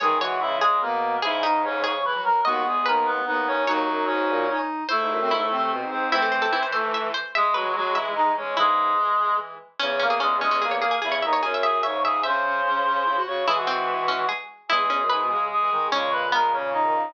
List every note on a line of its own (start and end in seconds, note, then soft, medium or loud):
0.00 0.17 D#3 loud
0.00 0.77 E3 medium
0.00 0.77 G#3 medium
0.00 0.18 G#4 medium
0.00 0.19 C#5 loud
0.00 0.18 G#5 medium
0.20 0.38 E3 medium
0.20 0.39 F#4 medium
0.20 0.55 C#5 loud
0.20 0.39 F#5 medium
0.40 0.77 C#3 medium
0.40 0.57 E4 medium
0.40 0.57 E5 medium
0.61 0.81 G#3 medium
0.61 0.81 G#4 medium
0.61 1.17 G#4 medium
0.81 1.18 B2 medium
0.81 1.16 A#3 medium
0.81 1.17 B3 medium
0.81 1.16 A#4 medium
1.22 1.91 G#2 loud
1.22 1.41 C#3 medium
1.22 1.43 E4 medium
1.22 1.39 G#4 loud
1.22 1.43 E5 medium
1.42 1.62 C#3 medium
1.42 1.78 D#4 medium
1.42 1.62 D#4 medium
1.42 1.62 D#5 medium
1.64 1.81 C#3 medium
1.64 1.82 C#4 medium
1.64 1.82 C#5 medium
1.84 2.03 C#3 medium
1.84 2.37 G#4 medium
1.84 2.02 C#5 medium
1.84 2.02 C#6 medium
2.05 2.14 E3 medium
2.05 2.21 B4 medium
2.05 2.21 B5 medium
2.15 2.24 F#3 medium
2.24 2.42 F#3 medium
2.24 2.41 A#4 medium
2.24 2.41 A#5 medium
2.45 2.63 D#2 loud
2.45 3.18 G#3 medium
2.45 3.18 B3 medium
2.45 2.64 F#4 medium
2.45 2.83 D#5 medium
2.45 2.64 F#5 medium
2.65 2.82 E2 medium
2.65 2.85 G#4 medium
2.65 2.85 G#5 medium
2.86 3.19 D#2 medium
2.86 3.07 A#4 medium
2.86 3.53 B4 medium
2.86 3.07 A#5 medium
3.06 3.25 B3 medium
3.06 3.25 B4 medium
3.26 3.63 D#2 medium
3.26 3.46 B3 medium
3.26 3.65 D#4 medium
3.26 3.46 B4 medium
3.47 3.65 C#4 medium
3.47 3.65 C#5 medium
3.67 3.84 D#2 loud
3.67 4.05 F#3 medium
3.67 4.46 D#4 medium
3.67 4.05 F#4 medium
3.67 4.46 F#4 medium
3.67 4.49 C#5 loud
3.88 4.05 F#2 medium
4.06 4.28 G#2 medium
4.06 4.58 C#4 medium
4.06 4.58 C#5 medium
4.29 4.47 A#2 loud
4.48 4.84 D#4 medium
4.89 5.71 A3 medium
4.89 5.16 E4 medium
4.89 5.71 A4 medium
4.89 5.27 C5 loud
5.00 5.10 G#2 medium
5.10 5.20 F#2 medium
5.20 5.30 F#2 medium
5.20 5.31 C4 medium
5.31 5.40 G#2 medium
5.31 5.49 E4 medium
5.31 6.06 E4 medium
5.40 5.50 A2 medium
5.51 5.70 C3 medium
5.51 6.11 C4 medium
5.71 5.81 B2 medium
5.81 5.91 G#2 medium
5.91 6.12 G#2 medium
5.91 6.09 C4 medium
5.91 6.09 C5 medium
6.11 7.12 E3 loud
6.11 6.47 A3 medium
6.11 6.47 C4 medium
6.11 6.63 C4 medium
6.11 6.22 E4 loud
6.11 6.63 C5 medium
6.22 6.32 A4 medium
6.32 6.41 C5 medium
6.42 6.52 A4 medium
6.52 7.06 E3 medium
6.52 6.62 E4 medium
6.63 6.72 C5 medium
6.72 7.08 A3 medium
6.72 7.08 A4 medium
6.72 6.91 C5 medium
6.94 7.13 E5 medium
7.14 7.32 C5 loud
7.35 8.31 G#3 loud
7.35 7.60 G#3 medium
7.35 7.54 G#3 medium
7.35 7.54 G#4 medium
7.35 7.54 E5 loud
7.54 7.72 F#3 medium
7.54 7.72 F#4 medium
7.54 7.91 B4 medium
7.65 7.74 E3 medium
7.75 7.95 F#3 medium
7.75 7.93 G#3 medium
7.75 7.95 F#4 medium
7.94 8.47 E3 medium
7.94 8.11 E4 medium
7.94 8.11 E5 medium
7.94 8.46 E5 medium
8.15 8.32 D#4 medium
8.15 8.32 D#5 medium
8.37 8.55 G#3 medium
8.37 8.54 C#4 medium
8.37 8.54 C#5 medium
8.57 8.93 G#2 medium
8.57 8.91 C#3 medium
8.57 8.91 E3 medium
8.57 9.36 G#3 medium
8.57 9.34 E4 loud
8.57 9.36 G#4 medium
8.98 9.17 E3 medium
9.19 9.55 E3 medium
9.80 10.83 E2 loud
9.80 10.00 C#3 medium
9.80 9.99 C#4 loud
9.80 9.99 C#4 medium
9.80 9.99 C#5 medium
9.99 10.09 C#3 medium
9.99 10.18 A#3 medium
9.99 10.09 C#4 medium
9.99 10.18 A#4 medium
10.10 10.19 C#3 medium
10.10 10.20 G#4 medium
10.20 10.40 C#3 medium
10.20 10.37 G#3 medium
10.20 10.37 C#4 medium
10.20 10.37 G#4 medium
10.41 10.60 G#3 medium
10.41 10.62 G#3 medium
10.41 10.51 C#4 medium
10.41 10.62 G#4 medium
10.51 10.61 C#4 medium
10.61 10.97 E3 medium
10.61 10.79 A#3 soft
10.61 10.71 G#4 medium
10.61 10.79 A#4 medium
10.71 10.81 C#5 medium
10.80 10.96 A#3 medium
10.80 10.91 G#4 medium
10.80 10.96 A#4 medium
10.91 11.01 G#4 medium
11.02 11.22 E2 medium
11.02 11.20 C#3 medium
11.02 11.23 E4 medium
11.02 11.11 G#4 medium
11.02 11.23 E5 medium
11.12 11.21 C#5 medium
11.22 11.41 D#2 medium
11.22 11.41 D#4 medium
11.22 11.41 D#5 medium
11.22 11.32 E5 medium
11.33 11.42 C#5 medium
11.43 11.82 F#2 medium
11.43 11.62 C#4 medium
11.43 11.52 G#4 medium
11.43 11.62 C#5 medium
11.54 11.63 E5 medium
11.62 11.81 G#4 medium
11.62 11.83 E5 medium
11.62 11.81 G#5 medium
11.83 12.20 G#2 medium
11.83 12.03 C#3 medium
11.83 12.00 C#5 medium
11.83 12.03 E5 medium
11.83 12.00 C#6 medium
12.03 12.21 C#3 medium
12.03 12.22 G#4 medium
12.03 12.22 E5 medium
12.03 12.22 G#5 medium
12.23 13.17 C#3 medium
12.23 12.43 C#4 medium
12.23 13.18 C5 medium
12.23 12.92 E5 medium
12.23 13.18 C6 medium
12.45 12.62 C#4 medium
12.66 12.83 C#4 medium
12.86 13.04 C#4 medium
13.06 13.15 E4 medium
13.16 13.26 F#4 medium
13.26 13.45 C#3 medium
13.26 13.44 F#4 medium
13.26 13.44 C#5 medium
13.26 13.44 C#6 medium
13.47 14.22 E3 medium
13.47 14.29 E3 medium
13.47 14.29 G#3 medium
13.47 13.67 E4 loud
13.47 13.56 G#4 medium
13.47 13.56 G#5 medium
13.56 13.66 F#4 medium
13.56 13.66 F#5 medium
13.67 14.05 C4 medium
13.67 14.26 F#4 medium
13.67 14.26 F#5 medium
14.08 14.26 C#4 medium
14.29 14.67 G#4 medium
14.69 14.79 E2 medium
14.69 15.28 E3 medium
14.69 15.28 G#3 medium
14.69 14.89 E4 loud
14.69 15.44 G#4 medium
14.69 15.44 G#5 medium
14.80 14.89 E2 medium
14.90 14.99 E2 medium
14.90 15.07 C#4 medium
15.00 15.09 F#2 medium
15.10 15.20 G#2 medium
15.10 15.43 B4 medium
15.20 15.30 B2 medium
15.30 15.49 C#3 medium
15.30 15.70 G#3 medium
15.51 15.87 G#4 medium
15.51 15.87 G#5 medium
15.61 15.70 E3 medium
15.71 15.89 D#3 medium
15.71 15.88 G#3 medium
15.91 17.06 A#2 medium
15.91 17.06 C#3 medium
15.91 16.26 G#3 loud
15.91 16.28 C#4 loud
15.91 16.10 C#5 medium
15.91 16.10 C#6 medium
16.12 16.31 B4 medium
16.12 16.31 B5 medium
16.32 16.51 G#3 medium
16.32 17.02 B3 medium
16.32 16.52 A#4 medium
16.32 16.52 A#5 medium
16.53 16.82 C#3 medium
16.53 16.70 C#4 medium
16.53 16.70 C#5 medium
16.73 17.11 D#4 medium
16.73 17.11 D#5 medium
16.84 16.93 D#3 medium
16.94 17.13 C#3 medium